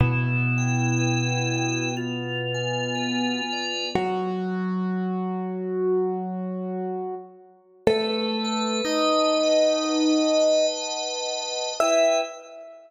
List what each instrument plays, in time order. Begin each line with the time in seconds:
0.00 acoustic grand piano B2 B3, drawbar organ E4
0.58 drawbar organ G5
0.99 drawbar organ B4
1.56 drawbar organ G5
1.97 drawbar organ F4
2.54 drawbar organ G#5
2.95 drawbar organ B4
3.53 drawbar organ D5
3.95 acoustic grand piano F#3 F#4
7.87 acoustic grand piano A3 A4, drawbar organ B4
8.44 drawbar organ A5
8.85 acoustic grand piano D#4 D#5, drawbar organ D#5
9.43 drawbar organ F#5
9.84 drawbar organ B4
10.41 drawbar organ A5
10.82 drawbar organ F#5
11.40 drawbar organ D#5
11.80 drawbar organ E4 B4 G5, acoustic grand piano E5